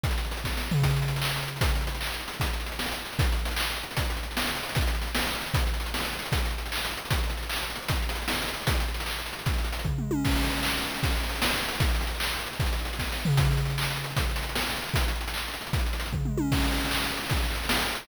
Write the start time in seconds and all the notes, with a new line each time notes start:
0.04 kick, closed hi-hat
0.11 closed hi-hat
0.18 closed hi-hat
0.25 closed hi-hat
0.31 closed hi-hat
0.37 closed hi-hat
0.44 kick, snare
0.57 snare
0.71 floor tom
0.82 kick, closed hi-hat
0.90 closed hi-hat
0.96 closed hi-hat
1.02 closed hi-hat
1.08 closed hi-hat
1.16 closed hi-hat
1.22 clap
1.29 closed hi-hat
1.36 closed hi-hat
1.43 closed hi-hat
1.48 closed hi-hat
1.56 closed hi-hat
1.61 kick, closed hi-hat
1.69 closed hi-hat
1.75 closed hi-hat
1.81 closed hi-hat
1.87 closed hi-hat
1.95 closed hi-hat
2.01 clap
2.06 closed hi-hat
2.14 closed hi-hat
2.20 closed hi-hat
2.28 closed hi-hat
2.33 closed hi-hat
2.40 kick, closed hi-hat
2.46 closed hi-hat
2.53 closed hi-hat
2.60 closed hi-hat
2.66 closed hi-hat
2.72 closed hi-hat
2.79 snare
2.85 closed hi-hat
2.92 closed hi-hat
3.05 closed hi-hat
3.13 closed hi-hat
3.19 kick, closed hi-hat
3.24 closed hi-hat
3.32 closed hi-hat
3.39 closed hi-hat
3.45 closed hi-hat
3.51 closed hi-hat
3.56 clap
3.64 closed hi-hat
3.70 closed hi-hat
3.77 closed hi-hat
3.83 closed hi-hat
3.91 closed hi-hat
3.97 kick, closed hi-hat
4.05 closed hi-hat
4.10 closed hi-hat
4.17 closed hi-hat
4.23 closed hi-hat
4.31 closed hi-hat
4.37 snare
4.42 closed hi-hat
4.48 closed hi-hat
4.55 closed hi-hat
4.63 closed hi-hat
4.69 closed hi-hat
4.75 kick, closed hi-hat
4.81 closed hi-hat
4.87 closed hi-hat
4.95 closed hi-hat
5.02 closed hi-hat
5.07 closed hi-hat
5.15 snare
5.22 closed hi-hat
5.27 closed hi-hat
5.33 closed hi-hat
5.41 closed hi-hat
5.46 closed hi-hat
5.54 kick, closed hi-hat
5.60 closed hi-hat
5.67 closed hi-hat
5.74 closed hi-hat
5.80 closed hi-hat
5.86 closed hi-hat
5.94 snare
6.00 closed hi-hat
6.05 closed hi-hat
6.13 closed hi-hat
6.19 closed hi-hat
6.25 closed hi-hat
6.32 kick, closed hi-hat
6.38 closed hi-hat
6.45 closed hi-hat
6.51 closed hi-hat
6.58 closed hi-hat
6.66 closed hi-hat
6.72 clap
6.78 closed hi-hat
6.85 closed hi-hat
6.91 closed hi-hat
6.97 closed hi-hat
7.05 closed hi-hat
7.10 kick, closed hi-hat
7.17 closed hi-hat
7.24 closed hi-hat
7.30 closed hi-hat
7.37 closed hi-hat
7.43 closed hi-hat
7.49 clap
7.56 closed hi-hat
7.63 closed hi-hat
7.70 closed hi-hat
7.76 closed hi-hat
7.82 closed hi-hat
7.88 kick, closed hi-hat
7.96 closed hi-hat
8.02 closed hi-hat
8.09 closed hi-hat
8.15 closed hi-hat
8.22 closed hi-hat
8.28 snare
8.34 closed hi-hat
8.42 closed hi-hat
8.48 closed hi-hat
8.54 closed hi-hat
8.61 closed hi-hat
8.67 kick, closed hi-hat
8.75 closed hi-hat
8.80 closed hi-hat
8.88 closed hi-hat
8.94 closed hi-hat
9.00 closed hi-hat
9.06 clap
9.19 closed hi-hat
9.26 closed hi-hat
9.33 closed hi-hat
9.39 closed hi-hat
9.46 kick, closed hi-hat
9.54 closed hi-hat
9.58 closed hi-hat
9.64 closed hi-hat
9.72 closed hi-hat
9.79 closed hi-hat
9.85 kick, floor tom
9.98 mid tom
10.11 high tom
10.25 kick, crash
10.31 closed hi-hat
10.36 closed hi-hat
10.43 closed hi-hat
10.50 closed hi-hat
10.56 closed hi-hat
10.63 clap
10.71 closed hi-hat
10.77 closed hi-hat
10.83 closed hi-hat
10.90 closed hi-hat
10.96 closed hi-hat
11.03 kick, closed hi-hat
11.10 closed hi-hat
11.16 closed hi-hat
11.23 closed hi-hat
11.29 closed hi-hat
11.35 closed hi-hat
11.42 snare
11.49 closed hi-hat
11.56 closed hi-hat
11.62 closed hi-hat
11.69 closed hi-hat
11.75 closed hi-hat
11.80 kick, closed hi-hat
11.89 closed hi-hat
11.95 closed hi-hat
12.01 closed hi-hat
12.07 closed hi-hat
12.15 closed hi-hat
12.20 clap
12.27 closed hi-hat
12.33 closed hi-hat
12.39 closed hi-hat
12.47 closed hi-hat
12.53 closed hi-hat
12.60 kick, closed hi-hat
12.66 closed hi-hat
12.73 closed hi-hat
12.79 closed hi-hat
12.85 closed hi-hat
12.93 closed hi-hat
12.99 kick, snare
13.12 snare
13.25 floor tom
13.37 kick, closed hi-hat
13.45 closed hi-hat
13.51 closed hi-hat
13.57 closed hi-hat
13.65 closed hi-hat
13.70 closed hi-hat
13.78 clap
13.83 closed hi-hat
13.90 closed hi-hat
13.96 closed hi-hat
14.04 closed hi-hat
14.10 closed hi-hat
14.17 kick, closed hi-hat
14.24 closed hi-hat
14.30 closed hi-hat
14.36 closed hi-hat
14.43 closed hi-hat
14.49 closed hi-hat
14.55 snare
14.61 closed hi-hat
14.70 closed hi-hat
14.76 closed hi-hat
14.83 closed hi-hat
14.89 closed hi-hat
14.94 kick, closed hi-hat
15.02 closed hi-hat
15.08 closed hi-hat
15.16 closed hi-hat
15.21 closed hi-hat
15.28 closed hi-hat
15.34 clap
15.48 closed hi-hat
15.54 closed hi-hat
15.61 closed hi-hat
15.67 closed hi-hat
15.73 kick, closed hi-hat
15.79 closed hi-hat
15.86 closed hi-hat
15.93 closed hi-hat
16.00 closed hi-hat
16.06 closed hi-hat
16.13 kick, floor tom
16.25 mid tom
16.38 high tom
16.52 kick, crash
16.58 closed hi-hat
16.64 closed hi-hat
16.73 closed hi-hat
16.77 closed hi-hat
16.85 closed hi-hat
16.91 clap
16.97 closed hi-hat
17.04 closed hi-hat
17.11 closed hi-hat
17.17 closed hi-hat
17.24 closed hi-hat
17.30 kick, closed hi-hat
17.37 closed hi-hat
17.44 closed hi-hat
17.51 closed hi-hat
17.55 closed hi-hat
17.64 closed hi-hat
17.69 snare
17.75 closed hi-hat
17.81 closed hi-hat
17.89 closed hi-hat
17.95 closed hi-hat
18.02 closed hi-hat